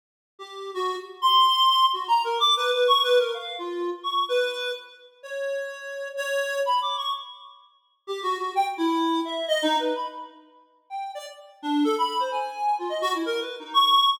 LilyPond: \new Staff { \time 5/4 \tempo 4 = 127 r8. g'8. fis'8 r8 c'''4. \tuplet 3/2 { fis'8 ais''8 ais'8 } | \tuplet 3/2 { d'''8 b'8 b'8 cis'''8 b'8 ais'8 } f''8 f'8. r16 cis'''8 b'4 | r4 cis''2 cis''4 \tuplet 3/2 { b''8 d'''8 cis'''8 } | r2 \tuplet 3/2 { g'8 fis'8 fis'8 } g''16 r16 e'4 e''8 |
\tuplet 3/2 { dis''8 dis'8 b'8 } b''16 r4. r16 g''8 d''16 r8. d'8 | a'16 b''8 c''16 gis''4 f'16 dis''16 fis'16 e'16 \tuplet 3/2 { ais'8 b'8 dis'8 } cis'''4 | }